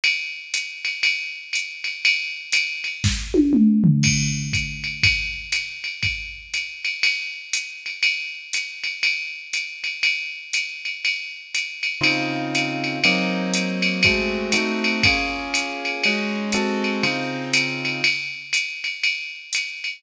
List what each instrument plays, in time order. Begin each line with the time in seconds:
0.04 ride
0.54 hi-hat pedal, ride
0.85 ride
1.03 ride
1.53 hi-hat pedal, ride
1.84 ride
2.05 ride
2.52 hi-hat pedal, ride
2.84 ride
3.04 kick, snare
3.34 high tom
3.53 mid tom
3.84 floor tom
4.03 kick, crash, ride
4.53 kick, hi-hat pedal, ride
4.84 ride
5.03 kick, ride
5.52 hi-hat pedal, ride
5.84 ride
6.03 kick, ride
6.54 hi-hat pedal, ride
6.85 ride
7.03 ride
7.53 hi-hat pedal, ride
7.86 ride
8.03 ride
8.53 hi-hat pedal, ride
8.84 ride
9.03 ride
9.53 hi-hat pedal, ride
9.84 ride
10.03 ride
10.53 hi-hat pedal, ride
10.85 ride
11.05 ride
11.55 hi-hat pedal, ride
11.83 ride
12.01 acoustic grand piano C#3 C4 D#4 F4, ride
12.55 hi-hat pedal, ride
12.84 ride
13.04 acoustic grand piano F#3 A#3 C4 D#4, ride
13.54 hi-hat pedal, ride
13.82 ride
14.03 acoustic grand piano G#3 A3 C4 F#4, kick, ride
14.52 acoustic grand piano A3 C4 D#4 F#4, hi-hat pedal, ride
14.84 ride
15.03 acoustic grand piano A#3 C#4 F4 G#4, kick, ride
15.54 hi-hat pedal, ride
15.85 ride
16.04 acoustic grand piano G#3 C#4 D#4 F#4, ride
16.52 acoustic grand piano G#3 C4 F#4 A4, hi-hat pedal, ride
16.84 ride
17.03 acoustic grand piano C#3 C4 D#4 F4, ride
17.53 hi-hat pedal, ride
17.85 ride
18.04 ride
18.53 hi-hat pedal, ride
18.84 ride
19.04 ride
19.53 hi-hat pedal, ride
19.84 ride